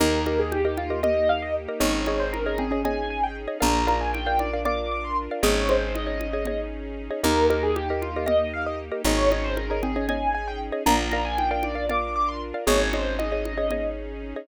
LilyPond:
<<
  \new Staff \with { instrumentName = "Acoustic Grand Piano" } { \time 7/8 \key ees \major \tempo 4 = 116 bes'8 bes'16 aes'16 g'16 g'16 f'8 ees''8 f''16 ees''16 r8 | des''8 des''16 c''16 bes'16 bes'16 aes'8 aes''8 aes''16 g''16 r8 | bes''8 bes''16 aes''16 g''16 g''16 d''8 d'''8 d'''16 c'''16 r8 | des''8 c''8 ees''4. r4 |
bes'8 bes'16 aes'16 g'16 g'16 f'8 ees''8 f''16 ees''16 r8 | des''8 des''16 c''16 bes'16 bes'16 aes'8 aes''8 aes''16 g''16 r8 | bes''8 bes''16 aes''16 g''16 g''16 d''8 d'''8 d'''16 c'''16 r8 | des''8 c''8 ees''4. r4 | }
  \new Staff \with { instrumentName = "Xylophone" } { \time 7/8 \key ees \major ees'2 ees''4. | ees'4 r8 c'16 des'8. r4 | d'2 d''4. | aes'4 r2 r8 |
ees'2 ees''4. | ees'4 r8 c'16 des'8. r4 | d'2 d''4. | aes'4 r2 r8 | }
  \new Staff \with { instrumentName = "Xylophone" } { \time 7/8 \key ees \major <g' bes' ees''>8 <g' bes' ees''>8. <g' bes' ees''>8 <g' bes' ees''>16 <g' bes' ees''>4~ <g' bes' ees''>16 <g' bes' ees''>16 | <aes' des'' ees''>8 <aes' des'' ees''>8. <aes' des'' ees''>8 <aes' des'' ees''>16 <aes' des'' ees''>4~ <aes' des'' ees''>16 <aes' des'' ees''>16 | <bes' d'' f''>8 <bes' d'' f''>8. <bes' d'' f''>8 <bes' d'' f''>16 <bes' d'' f''>4~ <bes' d'' f''>16 <bes' d'' f''>16 | <aes' des'' ees''>8 <aes' des'' ees''>8. <aes' des'' ees''>8 <aes' des'' ees''>16 <aes' des'' ees''>4~ <aes' des'' ees''>16 <aes' des'' ees''>16 |
<g' bes' ees''>8 <g' bes' ees''>8. <g' bes' ees''>8 <g' bes' ees''>16 <g' bes' ees''>4~ <g' bes' ees''>16 <g' bes' ees''>16 | <aes' des'' ees''>8 <aes' des'' ees''>8. <aes' des'' ees''>8 <aes' des'' ees''>16 <aes' des'' ees''>4~ <aes' des'' ees''>16 <aes' des'' ees''>16 | <bes' d'' f''>8 <bes' d'' f''>8. <bes' d'' f''>8 <bes' d'' f''>16 <bes' d'' f''>4~ <bes' d'' f''>16 <bes' d'' f''>16 | <aes' des'' ees''>8 <aes' des'' ees''>8. <aes' des'' ees''>8 <aes' des'' ees''>16 <aes' des'' ees''>4~ <aes' des'' ees''>16 <aes' des'' ees''>16 | }
  \new Staff \with { instrumentName = "Electric Bass (finger)" } { \clef bass \time 7/8 \key ees \major ees,2.~ ees,8 | aes,,2.~ aes,,8 | bes,,2.~ bes,,8 | aes,,2.~ aes,,8 |
ees,2.~ ees,8 | aes,,2.~ aes,,8 | bes,,2.~ bes,,8 | aes,,2.~ aes,,8 | }
  \new Staff \with { instrumentName = "String Ensemble 1" } { \time 7/8 \key ees \major <bes ees' g'>2.~ <bes ees' g'>8 | <des' ees' aes'>2.~ <des' ees' aes'>8 | <d' f' bes'>2.~ <d' f' bes'>8 | <des' ees' aes'>2.~ <des' ees' aes'>8 |
<bes ees' g'>2.~ <bes ees' g'>8 | <des' ees' aes'>2.~ <des' ees' aes'>8 | <d' f' bes'>2.~ <d' f' bes'>8 | <des' ees' aes'>2.~ <des' ees' aes'>8 | }
  \new DrumStaff \with { instrumentName = "Drums" } \drummode { \time 7/8 cgl8 cgho8 cgho8 cgho8 cgl4. | cgl8 cgho8 cgho8 cgho8 cgl4. | cgl8 cgho8 cgho8 cgho8 cgl4. | cgl8 cgho8 cgho8 cgho8 cgl4. |
cgl8 cgho8 cgho8 cgho8 cgl4. | cgl8 cgho8 cgho8 cgho8 cgl4. | cgl8 cgho8 cgho8 cgho8 cgl4. | cgl8 cgho8 cgho8 cgho8 cgl4. | }
>>